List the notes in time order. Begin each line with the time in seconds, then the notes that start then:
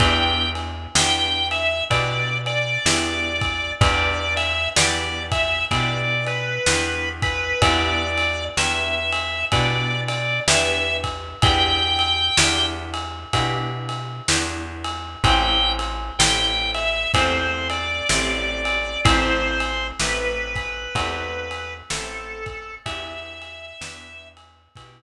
0.00 E2 B3 D4 E4 G4 G5, kick, ride
0.55 ride
0.95 E2 B3 D4 E4 G4 G5, snare
1.51 E5, ride
1.90 B2 B3 D4 E4 G4 D5, kick, ride
2.46 D5, ride
2.86 E2 B3 D4 E4 G4, snare
3.41 kick, ride
3.81 E2 B3 D4 E4 G4 D5, kick, ride
4.37 E5, ride
4.76 E2 B3 D4 E4 G4 D5, snare
5.32 E5, kick, ride
5.71 B2 B3 D4 E4 G4 D5, kick, ride
6.26 B4, ride
6.66 E2 B3 D4 E4 G4, snare
7.22 B4, kick, ride
7.62 E2 B3 D4 E4 G4 D5, kick, ride
8.17 ride
8.57 E2 B3 D4 E4 G4 E5, snare
9.13 ride
9.52 B2 B3 D4 E4 G4 D5, kick, ride
10.08 D5, ride
10.48 E2 B3 D4 E4 G4 E5, snare
11.04 kick, ride
11.42 E2 B3 D4 E4 G4 G5, kick, ride
11.99 ride
12.37 E2 B3 D4 E4 G4, snare
12.94 ride
13.33 B2 B3 D4 E4 G4, kick, ride
13.89 ride
14.28 E2 B3 D4 E4 G4, snare
14.84 ride
15.24 A1 A3 C4 E4 G4 G5, kick, ride
15.79 ride
16.19 A1 A3 C4 E4 G4 G5, snare
16.74 E5, ride
17.14 E2 A3 C4 E4 G4 C5, kick, ride
17.70 D5, ride
18.09 A1 A3 C4 E4 G4, snare
18.65 ride
19.05 A1 A3 C4 E4 G4 C5, kick, ride
19.60 ride
20.00 A1 A3 C4 E4 G4 B4, snare
20.56 kick, ride
20.95 E2 A3 C4 E4 G4, kick, ride
21.51 ride
21.90 A1 A3 C4 E4 G4 A4, snare
22.46 kick, ride
22.86 E2 B3 D4 E4 G4 E5, kick, ride
23.42 ride
23.81 E2 B3 D4 E4 G4, snare
24.37 ride
24.76 B2 B3 D4 E4 G4, kick, ride